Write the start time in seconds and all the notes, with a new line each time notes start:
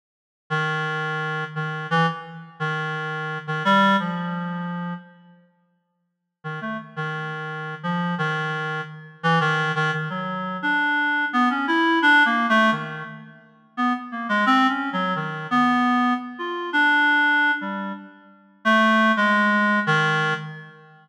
0.50 D#3
1.55 D#3
1.91 E3
2.60 D#3
3.47 D#3
3.65 G3
4.00 F3
6.44 D#3
6.61 A3
6.96 D#3
7.83 F3
8.18 D#3
9.23 E3
9.40 D#3
9.75 D#3
9.93 D#3
10.10 F#3
10.62 D4
11.33 B3
11.50 C#4
11.68 E4
12.02 D4
12.25 A#3
12.49 A3
12.72 D#3
13.77 B3
14.12 A#3
14.29 G#3
14.46 C4
14.69 C#4
14.93 F#3
15.16 D#3
15.51 B3
16.39 F4
16.73 D4
17.61 G3
18.65 A3
19.17 G#3
19.87 D#3